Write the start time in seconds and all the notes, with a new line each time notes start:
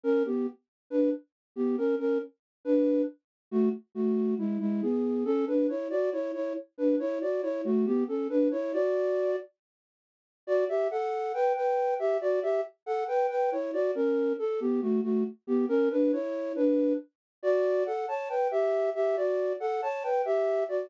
0.03 C#4 A#4
0.25 B3 G4
0.90 D4 B4
1.56 B3 G4
1.78 C#4 A#4
1.99 C#4 A#4
2.65 D4 B4
3.51 A3 F#4
3.95 A3 F#4
4.38 G#3 E4
4.60 G#3 E4
4.82 B3 G#4
5.25 C#4 A4
5.47 D4 B4
5.69 E4 C#5
5.90 F#4 D5
6.12 E4 C#5
6.34 E4 C#5
6.78 D4 B4
6.99 E4 C#5
7.21 F#4 D5
7.42 E4 C#5
7.64 A3 F#4
7.86 B3 G4
8.08 C#4 A4
8.30 D4 B4
8.51 E4 C#5
8.73 F#4 D5
10.47 F#4 D5
10.69 G4 E5
10.91 A4 F#5
11.34 B4 G5
11.56 B4 G5
11.99 G4 E5
12.21 F#4 D5
12.43 G4 E5
12.86 A4 F#5
13.08 B4 G5
13.30 B4 G5
13.52 E4 C#5
13.73 F#4 D5
13.95 C#4 A#4
14.39 A4
14.60 B3 G4
14.82 A3 F#4
15.03 A3 F#4
15.47 B3 G4
15.69 C#4 A#4
15.91 D4 B4
16.13 E4 C#5
16.56 D4 B4
17.43 F#4 D5
17.86 A4 F#5
18.08 C#5 A5
18.29 B4 G5
18.51 G4 E5
18.95 G4 E5
19.16 F#4 D5
19.60 A4 F#5
19.82 C#5 A5
20.03 B4 G5
20.25 G4 E5
20.69 F#4 D5